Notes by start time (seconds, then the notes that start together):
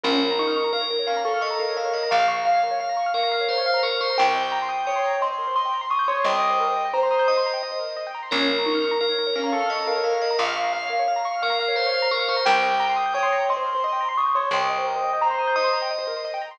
0.04 A#1 C#4 A#4
0.13 C#5
0.22 F5
0.31 A#5
0.39 D#4 C#6
0.47 F6
0.56 C#6
0.64 A#5
0.73 A#4 F5
0.81 C#5
0.90 A#4
0.99 C#5
1.07 C#4 F5
1.17 A#5
1.25 A4 C#6
1.34 F6
1.41 D#5 C#6
1.51 A#5
1.59 A#4 F5
1.68 C#5
1.77 A#4 F5
1.85 C#5
1.93 D#5 F5
2.03 A#5
2.11 A#1 F5 C#6
2.20 F6
2.28 C#6
2.36 A#5
2.45 F5
2.54 C#5
2.63 A#4
2.71 C#5
2.80 F5
2.89 A#5
2.97 C#6
3.06 F6
3.14 A#4 F5 C#6
3.23 A#5
3.32 F5
3.41 C#5
3.49 A#4 C5
3.58 C#5
3.66 F5
3.74 A#5
3.83 A#4 C#6
3.92 F6
4.01 C5 C#6
4.10 A#5
4.18 C2 A#4 G5
4.27 C5
4.35 D#5
4.43 G5
4.52 A#5
4.62 C6
4.69 D#6
4.78 G6
4.86 C#5 G5 D#6
4.96 C6
5.05 A#5
5.13 G5
5.21 D#5 C6
5.30 C5
5.38 A#4
5.47 C5
5.56 D#5 C6
5.66 G5
5.74 A#5
5.81 C6
5.90 C#6 D#6
5.99 G6
6.08 C#5 C6 D#6
6.16 C6
6.24 C2 D#5 G5 A#5
6.32 G5
6.42 D#5
6.50 C5
6.60 A#4
6.67 C5
6.76 D#5
6.85 G5
6.93 C5 A#5
7.03 C6
7.11 D#6
7.19 G6
7.28 D#5 D#6
7.37 C6
7.46 A#5
7.54 G5
7.63 D#5
7.72 C5
7.79 A#4
7.89 C5
7.97 D#5
8.07 G5
8.15 A#5
8.23 C6
8.31 A#1 C#4 A#4
8.40 C#5
8.48 F5
8.58 A#5
8.65 D#4 C#6
8.75 F6
8.84 C#6
8.91 A#5
9.01 A#4 F5
9.09 C#5
9.19 A#4
9.27 C#5
9.36 C#4 F5
9.44 A#5
9.52 A4 C#6
9.61 F6
9.69 D#5 C#6
9.79 A#5
9.87 A#4 F5
9.96 C#5
10.04 A#4 F5
10.13 C#5
10.21 D#5 F5
10.31 A#5
10.38 A#1 F5 C#6
10.48 F6
10.56 C#6
10.64 A#5
10.73 F5
10.82 C#5
10.90 A#4
10.99 C#5
11.08 F5
11.16 A#5
11.25 C#6
11.34 F6
11.42 A#4 F5 C#6
11.50 A#5
11.59 F5
11.68 C#5
11.76 A#4 C5
11.86 C#5
11.94 F5
12.02 A#5
12.11 A#4 C#6
12.20 F6
12.28 C5 C#6
12.36 A#5
12.45 C2 A#4 G5
12.55 C5
12.63 D#5
12.71 G5
12.80 A#5
12.89 C6
12.96 D#6
13.06 G6
13.14 C#5 G5 D#6
13.23 C6
13.32 A#5
13.40 G5
13.49 D#5 C6
13.57 C5
13.66 A#4
13.75 C5
13.83 D#5 C6
13.93 G5
14.01 A#5
14.09 C6
14.17 C#6 D#6
14.26 G6
14.35 C#5 C6 D#6
14.43 C6
14.51 C2 D#5 G5 A#5
14.61 G5
14.69 D#5
14.78 C5
14.87 A#4
14.96 C5
15.04 D#5
15.13 G5
15.21 C5 A#5
15.30 C6
15.39 D#6
15.47 G6
15.56 D#5 D#6
15.64 C6
15.73 A#5
15.82 G5
15.91 D#5
15.98 C5
16.07 A#4
16.17 C5
16.25 D#5
16.34 G5
16.42 A#5
16.51 C6